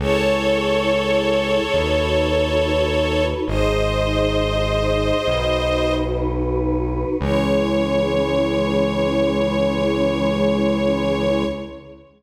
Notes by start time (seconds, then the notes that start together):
0.00 C#2 E4 G#4 A4 C#5
1.74 D#2 D#4 F#4 B4
3.47 G#1 D#4 G#4 C5 D#5
5.27 B1 D#4 F#4 B4
7.20 C#2 E3 G#3 C#4 C#5